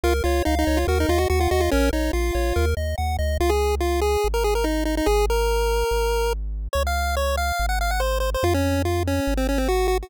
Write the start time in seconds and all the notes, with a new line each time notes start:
0.03 C#2 F4 A#4
0.24 C#2 F4 C#5
0.45 C#2 D#4 F5
0.59 D#4
0.67 C#2 C#5
0.77 F4
0.87 D#2 F#4 A#4
1.00 D#4
1.09 D#2 F4 D#5
1.18 F#4
1.30 D#2 F#4 F#5
1.40 F4
1.51 D#2 F#4 D#5
1.60 F4
1.71 A#1 C#4 A#4
1.93 A#1 D#4 C#5
2.13 A#1 F4 F5
2.35 A#1 C#5
2.56 D#2 A#4
2.77 D#2 D#5
2.98 D#2 F#5
3.19 D2 D#5
3.40 C#2 F4
3.49 G#4
3.80 F4
4.01 G#4
4.24 G#1
4.34 A#4
4.44 G#4
4.55 A#4
4.64 D#4
4.85 D#4
4.97 D#4
5.06 G#1 G#4
5.30 A#4
5.91 G#1
6.73 C#2 C#5
6.87 F5
7.17 C#5
7.37 F5
7.59 G#1
7.69 F#5
7.81 F5
7.91 F#5
8.00 C5
8.20 C5
8.34 C5
8.43 F2 F4
8.54 C#4
8.85 F4
9.07 C#4
9.27 G#1
9.37 C4
9.49 C#4
9.58 C4
9.68 F#4
9.88 F#4
10.02 F#4